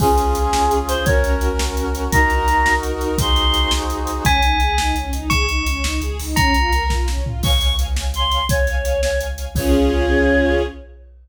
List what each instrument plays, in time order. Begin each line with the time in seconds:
0.00 synth bass 2 C#2, brass section C#4 F4 G#4, string ensemble 1 C#4 F4 G#4, choir aahs G#4, kick, crash
0.16 string ensemble 1 C#4 F4 G#4, closed hi-hat
0.35 string ensemble 1 C#4 F4 G#4, closed hi-hat
0.53 synth bass 2 C#2, string ensemble 1 C#4 F4 G#4, snare
0.71 string ensemble 1 C#4 F4 G#4, closed hi-hat
0.88 string ensemble 1 C#4 F4 G#4, choir aahs C5, closed hi-hat
1.05 synth bass 2 C#2, string ensemble 1 C#4 F#4 A#4, brass section C#4 F#4 A#4, choir aahs C#5, kick, closed hi-hat
1.24 string ensemble 1 C#4 F#4 A#4, closed hi-hat
1.41 string ensemble 1 C#4 F#4 A#4, closed hi-hat
1.59 synth bass 2 C#2, string ensemble 1 C#4 F#4 A#4, snare
1.77 string ensemble 1 C#4 F#4 A#4, closed hi-hat
1.95 string ensemble 1 C#4 F#4 A#4, closed hi-hat
2.12 synth bass 2 C#2, brass section D#4 F#4 A#4, string ensemble 1 D#4 F#4 A#4, choir aahs A#5, kick, closed hi-hat
2.30 string ensemble 1 D#4 F#4 A#4, closed hi-hat
2.47 string ensemble 1 D#4 F#4 A#4, closed hi-hat
2.65 synth bass 2 C#2, string ensemble 1 D#4 F#4 A#4, snare
2.83 string ensemble 1 D#4 F#4 A#4, closed hi-hat
3.01 string ensemble 1 D#4 F#4 A#4, closed hi-hat
3.18 synth bass 2 C#2, brass section D#4 F#4 G#4 C5, choir aahs C6, kick, closed hi-hat
3.36 closed hi-hat
3.54 closed hi-hat
3.71 synth bass 2 C#2, snare
3.90 closed hi-hat
4.07 closed hi-hat
4.25 synth bass 2 C#2, string ensemble 1 C#4, tubular bells G#5, kick, closed hi-hat
4.43 synth bass 2 C#2, string ensemble 1 D#4, closed hi-hat
4.60 synth bass 2 C#2, string ensemble 1 G#4, closed hi-hat
4.78 synth bass 2 C#2, string ensemble 1 D#4, snare
4.95 synth bass 2 C#2, string ensemble 1 C#4, closed hi-hat
5.13 synth bass 2 C#2, string ensemble 1 D#4, closed hi-hat
5.29 synth bass 2 C#2, string ensemble 1 G#4, tubular bells C#6, kick, closed hi-hat
5.48 synth bass 2 C#2, string ensemble 1 D#4, closed hi-hat
5.66 synth bass 2 C#2, string ensemble 1 C#4, closed hi-hat
5.84 synth bass 2 C#2, string ensemble 1 D#4, snare
6.01 synth bass 2 C#2, string ensemble 1 G#4, closed hi-hat
6.19 synth bass 2 C#2, string ensemble 1 D#4, open hi-hat
6.36 synth bass 2 C#2, string ensemble 1 C#4, tubular bells A#5, kick, closed hi-hat
6.54 synth bass 2 C#2, string ensemble 1 F4, closed hi-hat
6.72 synth bass 2 C#2, string ensemble 1 A#4, closed hi-hat
6.90 synth bass 2 B1, string ensemble 1 F4, kick, snare
7.08 string ensemble 1 C#4, snare
7.17 synth bass 2 C2
7.24 string ensemble 1 F4, floor tom
7.43 synth bass 2 C#2, string ensemble 1 C#5 F5 G#5, choir aahs C#6, kick, crash
7.60 string ensemble 1 C#5 F5 G#5, closed hi-hat
7.79 string ensemble 1 C#5 F5 G#5, closed hi-hat
7.96 string ensemble 1 C#5 F5 G#5, snare
8.14 string ensemble 1 C#5 F5 G#5, choir aahs C6, closed hi-hat
8.31 string ensemble 1 C#5 F5 G#5, closed hi-hat
8.49 synth bass 2 C#2, string ensemble 1 C#5 F5 G#5, choir aahs C#5, kick, closed hi-hat
8.67 string ensemble 1 C#5 F5 G#5, closed hi-hat
8.85 string ensemble 1 C#5 F5 G#5, closed hi-hat
9.03 choir aahs C#5, string ensemble 1 C#5 F5 G#5, snare
9.20 string ensemble 1 C#5 F5 G#5, closed hi-hat
9.38 string ensemble 1 C#5 F5 G#5, closed hi-hat
9.55 synth bass 2 C#2, string ensemble 1 C#4 F4 G#4, choir aahs C#5, kick, crash